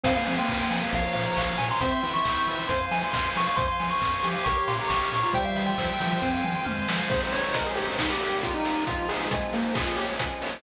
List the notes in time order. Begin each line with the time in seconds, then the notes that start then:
0.03 F2 C4 C5 F5 G#5, kick, crash
0.16 A#3 F5
0.25 F3 C4 G#5, open hi-hat
0.38 A#3 G5 C6
0.48 F2 F6, kick, snare
0.60 C6
0.70 F3 G#5, open hi-hat
0.82 F5
0.91 A#1 F3 A#4 C#5 F5, kick, closed hi-hat
1.05 C#5
1.13 A#2 F5, open hi-hat
1.26 A#5
1.36 A#1 F5 C#6, kick, clap
1.46 F6
1.58 A#2 G#5 C#6, open hi-hat
1.69 A#5 C6
1.81 E2 C4 C5 E5 G5 C6, kick, closed hi-hat
1.91 E5 C6
2.02 E3 E4 G5, open hi-hat
2.14 C6 C#6
2.25 E2 E6, kick, clap
2.37 G6
2.47 E3 E6, open hi-hat
2.58 C6
2.68 F2 C5 F5 G#5 C6, kick, closed hi-hat
2.80 F5
2.91 F3 G#5, open hi-hat
3.04 C6
3.12 F2 C6 F6, kick, snare
3.23 C6
3.35 F3 G#5 C#6, open hi-hat
3.47 F5 C#6
3.56 F2 C5 F5 G#5 C6, kick, closed hi-hat
3.67 F5 C6
3.80 F3 G#5, open hi-hat
3.91 C6 C#6
4.01 F2 F6, kick, snare
4.14 C6
4.23 F3 G4 G#5, open hi-hat
4.33 F5
4.44 A#1 A#4 C#5 F5 C#6, kick, closed hi-hat
4.58 C#5
4.67 A#2 F5 C6, open hi-hat
4.79 G4 A#5
4.88 A#1 C#6, kick, snare
5.03 F6
5.11 A#2 C#6, open hi-hat
5.22 F4 A#5 C#6
5.33 E2 G3 C5 E5 G5, kick, closed hi-hat
5.44 E5 F5
5.56 E3 G5, open hi-hat
5.66 G5 C6
5.78 E2 F3 E6, kick, clap
5.90 G6
6.00 E3 F3 E6, open hi-hat
6.11 C6
6.20 F2 C4 C5 F5 G#5, kick
6.33 F5
6.44 F3 G#5, mid tom
6.55 C6
6.65 F2 F6, high tom
6.79 C6
6.88 F3 G#5, snare
6.98 F5
7.10 G#3 C4 D#4 G#4 C5, kick, crash
7.22 C5
7.32 C5 C#5, open hi-hat
7.44 C#5
7.53 A#4 D#5, kick, closed hi-hat
7.66 G#4
7.75 G4 C5, open hi-hat
7.99 D#3 G3 A#3 D#4, kick, snare
8.10 G4
8.21 A#4, open hi-hat
8.43 F4 G5, kick, closed hi-hat
8.54 D#4
8.63 A#4, open hi-hat
8.86 F3 G#3 C4 F4, kick, closed hi-hat
9.08 G#4 C5, open hi-hat
9.31 G#3 G#5, kick, closed hi-hat
9.53 A#3 C5, open hi-hat
9.74 F3 G#3 C#4 F4 G#4, kick, snare
9.96 G4 C#5, open hi-hat
10.19 G#5, kick, closed hi-hat
10.42 C#5, open hi-hat